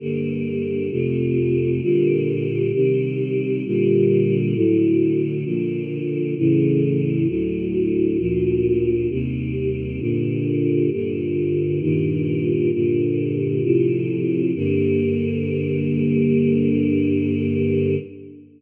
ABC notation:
X:1
M:4/4
L:1/8
Q:1/4=66
K:Gm
V:1 name="Choir Aahs"
[G,,D,B,]2 [F,,C,A,]2 [B,,D,G,]2 [C,E,G,]2 | [B,,D,G,]2 [A,,D,^F,]2 [B,,D,=F,]2 [A,,^C,=E,]2 | [D,,A,,^F,]2 [D,,B,,=F,]2 [E,,C,G,]2 [G,,B,,D,]2 | [G,,B,,D,]2 [G,,B,,E,]2 [G,,B,,D,]2 [A,,C,F,]2 |
[G,,D,B,]8 |]